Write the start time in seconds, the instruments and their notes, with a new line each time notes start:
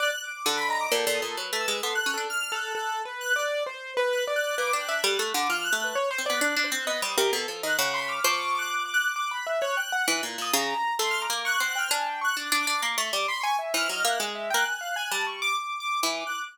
0.00 acoustic grand piano D5, lead 1 (square) F#6
0.23 lead 1 (square) D6
0.46 orchestral harp D3, lead 1 (square) F#6
0.57 lead 1 (square) B5
0.69 acoustic grand piano D#5, lead 1 (square) A#5
0.81 lead 1 (square) D6
0.92 orchestral harp A#2, acoustic grand piano A4, lead 1 (square) G5
1.07 orchestral harp A#2, acoustic grand piano A4
1.15 lead 1 (square) D#6
1.22 orchestral harp A#2, acoustic grand piano A4
1.37 orchestral harp F#3, acoustic grand piano B4
1.53 orchestral harp A3
1.60 lead 1 (square) E6
1.68 orchestral harp G#3
1.83 orchestral harp B3, acoustic grand piano A4, lead 1 (square) C6
1.95 acoustic grand piano A4, lead 1 (square) F#6
2.06 orchestral harp C#4
2.14 orchestral harp D4, acoustic grand piano A4
2.30 lead 1 (square) F6
2.52 acoustic grand piano A4, lead 1 (square) F#6
2.75 acoustic grand piano A4, lead 1 (square) F#6
3.05 acoustic grand piano B4
3.21 lead 1 (square) F#6
3.36 acoustic grand piano D5
3.66 acoustic grand piano C5
3.97 acoustic grand piano B4
4.12 lead 1 (square) F#6
4.27 acoustic grand piano D5
4.36 lead 1 (square) F#6
4.58 orchestral harp A#3, acoustic grand piano B4, lead 1 (square) D6
4.73 orchestral harp D4, acoustic grand piano G5
4.81 lead 1 (square) F#6
4.89 orchestral harp D4, acoustic grand piano E5
5.03 orchestral harp G3, acoustic grand piano A4, lead 1 (square) F#6
5.19 orchestral harp A3
5.34 orchestral harp D3, lead 1 (square) D6
5.50 orchestral harp F3, lead 1 (square) F6
5.64 lead 1 (square) F#6
5.73 orchestral harp A3
5.79 lead 1 (square) F#6
5.84 acoustic grand piano B4
5.95 acoustic grand piano C#5
6.11 acoustic grand piano C5
6.18 orchestral harp C4
6.26 orchestral harp B3, acoustic grand piano D5, lead 1 (square) F#6
6.41 orchestral harp D4, lead 1 (square) F#6
6.56 orchestral harp D4
6.64 acoustic grand piano C5
6.71 orchestral harp C4, lead 1 (square) F#6
6.87 orchestral harp B3, acoustic grand piano D#5
7.02 orchestral harp G3, acoustic grand piano C5, lead 1 (square) D#6
7.18 orchestral harp C3, acoustic grand piano A#4
7.33 orchestral harp B2, acoustic grand piano A4
7.48 orchestral harp F3, acoustic grand piano A4
7.63 orchestral harp D#3, acoustic grand piano D#5, lead 1 (square) F#6
7.78 orchestral harp C#3, acoustic grand piano F#5, lead 1 (square) F#6
7.94 lead 1 (square) B5, acoustic grand piano C6
8.08 acoustic grand piano D6, lead 1 (square) F6
8.24 orchestral harp F3, lead 1 (square) C#6, acoustic grand piano D6
8.55 acoustic grand piano D6, lead 1 (square) F#6
8.71 lead 1 (square) F#6
8.85 acoustic grand piano D6
8.94 lead 1 (square) F#6
9.04 lead 1 (square) F#6
9.16 acoustic grand piano D6, lead 1 (square) F#6
9.31 acoustic grand piano B5
9.47 acoustic grand piano E5
9.61 acoustic grand piano C#5, lead 1 (square) F#6
9.77 acoustic grand piano G5, lead 1 (square) F#6
9.92 acoustic grand piano F#5, lead 1 (square) F#6
10.08 orchestral harp E3, lead 1 (square) F#6
10.23 orchestral harp A#2
10.38 orchestral harp A#2, lead 1 (square) D#6
10.53 orchestral harp C#3, acoustic grand piano A#5
10.99 orchestral harp A3, acoustic grand piano C6
11.11 lead 1 (square) F6
11.21 acoustic grand piano A#5, lead 1 (square) D6
11.30 orchestral harp A#3
11.45 acoustic grand piano C#6, lead 1 (square) F#6
11.60 orchestral harp C4, acoustic grand piano F#5
11.68 lead 1 (square) F#6
11.75 acoustic grand piano G5, lead 1 (square) F6
11.91 orchestral harp D4, acoustic grand piano G#5
12.06 acoustic grand piano G5
12.21 acoustic grand piano C#6, lead 1 (square) F#6
12.37 orchestral harp D4, acoustic grand piano D6
12.47 lead 1 (square) F#6
12.52 orchestral harp D4, acoustic grand piano D6
12.60 lead 1 (square) D6
12.67 orchestral harp D4, acoustic grand piano D6
12.82 orchestral harp A#3, acoustic grand piano D6
12.98 orchestral harp A3, acoustic grand piano C#6
13.13 orchestral harp G3, acoustic grand piano D6
13.28 lead 1 (square) B5, acoustic grand piano C6
13.41 acoustic grand piano G#5, lead 1 (square) C#6
13.59 acoustic grand piano E5
13.74 orchestral harp E3, acoustic grand piano C5, lead 1 (square) F6
13.89 orchestral harp F#3, acoustic grand piano D#5
14.05 orchestral harp A#3, acoustic grand piano E5
14.09 lead 1 (square) F#6
14.20 orchestral harp G#3, acoustic grand piano G#5
14.35 acoustic grand piano E5
14.50 orchestral harp A#3, acoustic grand piano G5
14.55 lead 1 (square) F#6
14.65 acoustic grand piano G#5, lead 1 (square) F#6
14.81 acoustic grand piano F5
14.96 acoustic grand piano G#5
15.11 orchestral harp G3, acoustic grand piano A5
15.27 acoustic grand piano C#6
15.42 acoustic grand piano D6
15.57 acoustic grand piano D6
15.80 acoustic grand piano D6
16.03 orchestral harp E3, acoustic grand piano D6
16.27 lead 1 (square) F#6